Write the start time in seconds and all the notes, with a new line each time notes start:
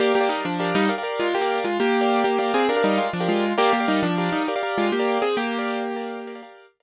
0.00 A#3 G4 A#4 D5 F5
0.15 A#3 G4
0.21 G4 A#4 D5 F5
0.29 G3 D#4
0.45 F3 D4
0.60 G4 A#4 D5 F5
0.75 G3 D#4
0.89 G4 A#4 D5 F5
0.98 G4 A#4 D5 F5
1.03 G4 A#4 D5 F5
1.20 G#3 F4
1.35 A#3 G4
1.42 G4 A#4 D5 F5
1.64 G#3 F4
1.80 A#3 G4
2.01 G4 A#4 D5 F5
2.24 A#3 G4
2.38 A#3 G4 A#4 D5 F5
2.54 C4 G#4
2.69 D4 G4 A#4 D5 F5
2.76 G4 A#4 D5 F5
2.83 G3 D#4 G4 A#4 D5 F5
2.98 G#3 F4
3.13 F3 D4
3.20 G4 A#4 D5 F5
3.29 G#3 F4
3.58 A#3 G4 A#4 D5 F5
3.73 A#3 G4
3.80 G4 A#4 D5 F5
3.88 G3 D#4
4.03 F3 D4
4.18 G4 A#4 D5 F5
4.32 G3 D#4
4.48 G4 A#4 D5 F5
4.56 G4 A#4 D5 F5
4.63 G4 A#4 D5 F5
4.78 G#3 F4
4.92 A#3 G4
5.00 G4 A#4 D5 F5
5.22 C4 G#4
5.37 A#3 G4
5.59 G4 A#4 D5 F5
5.96 G4 A#4 D5 F5
6.27 G4 A#4 D5 F5
6.35 G4 A#4 D5 F5
6.43 G4 A#4 D5 F5
6.80 G4 A#4 D5 F5